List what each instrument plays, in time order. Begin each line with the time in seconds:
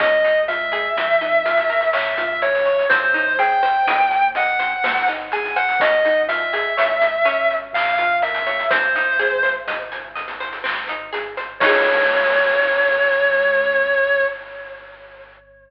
0.00 synth bass 1 C#2, harpsichord C#4, distortion guitar D#5, kick, closed hi-hat
0.24 harpsichord D#4, closed hi-hat
0.48 harpsichord F4, distortion guitar E5, closed hi-hat
0.72 harpsichord G#4, closed hi-hat
0.96 synth bass 1 F2, harpsichord C4, closed hi-hat
1.21 harpsichord D#4, closed hi-hat
1.46 harpsichord F4, closed hi-hat
1.57 closed hi-hat
1.70 harpsichord A#4, closed hi-hat
1.81 closed hi-hat
1.93 synth bass 1 A#1, harpsichord C#4, distortion guitar E5, clap
2.18 harpsichord F4, closed hi-hat
2.42 harpsichord A#4, distortion guitar C#5, closed hi-hat
2.55 closed hi-hat
2.65 harpsichord C#5, closed hi-hat
2.79 closed hi-hat
2.89 synth bass 1 C2, harpsichord C4, distortion guitar C5, kick, closed hi-hat
3.14 harpsichord D#4, closed hi-hat
3.39 harpsichord G#4, distortion guitar G5, closed hi-hat
3.63 harpsichord C5, closed hi-hat
3.87 synth bass 1 D#2, harpsichord D#5, closed hi-hat
4.11 harpsichord G#5, closed hi-hat
4.35 harpsichord D#5, distortion guitar F#5, closed hi-hat
4.59 harpsichord C5, closed hi-hat
4.84 synth bass 1 G#1, harpsichord C4, snare
5.08 harpsichord D#4, closed hi-hat
5.32 harpsichord G#4, distortion guitar G#5, closed hi-hat
5.45 closed hi-hat
5.56 harpsichord C5, distortion guitar F#5, closed hi-hat
5.69 closed hi-hat
5.80 synth bass 1 G#1, harpsichord C#4, distortion guitar D#5, kick, closed hi-hat
6.05 harpsichord D#4, closed hi-hat
6.28 harpsichord F4, distortion guitar E5, closed hi-hat
6.53 harpsichord G#4, closed hi-hat
6.77 synth bass 1 C#2, harpsichord C#5, closed hi-hat
7.01 harpsichord D#5, closed hi-hat
7.25 harpsichord C#4, closed hi-hat
7.51 closed hi-hat
7.73 synth bass 1 A#1, distortion guitar F5, clap
7.98 harpsichord F4, closed hi-hat
8.22 harpsichord A#4, distortion guitar E5, closed hi-hat
8.34 closed hi-hat
8.46 harpsichord C#5, closed hi-hat
8.59 closed hi-hat
8.70 synth bass 1 G#1, harpsichord C4, distortion guitar C5, kick, closed hi-hat
8.95 harpsichord D#4, closed hi-hat
9.19 harpsichord G#4, closed hi-hat
9.43 harpsichord C5, closed hi-hat
9.67 synth bass 1 C2, harpsichord D#5, closed hi-hat
9.92 harpsichord G#5, closed hi-hat
10.16 harpsichord D#5, closed hi-hat
10.28 closed hi-hat
10.40 harpsichord C5, closed hi-hat
10.53 closed hi-hat
10.64 synth bass 1 G#1, harpsichord C4, clap
10.88 harpsichord D#4, closed hi-hat
11.13 harpsichord G#4, closed hi-hat
11.37 harpsichord C5, closed hi-hat
11.60 synth bass 1 C#2, harpsichord C#4 D#4 F4, distortion guitar C#5, kick, crash
11.66 harpsichord G#4